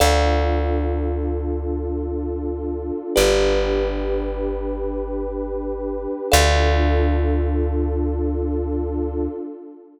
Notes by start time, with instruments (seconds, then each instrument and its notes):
0.00 electric bass (finger) D2, pad 2 (warm) D4 F4 A4, kalimba A4 D5 F5
3.15 electric bass (finger) G1, pad 2 (warm) D4 G4 B4, kalimba G4 B4 D5
6.31 electric bass (finger) D2, pad 2 (warm) D4 F4 A4, kalimba A4 D5 F5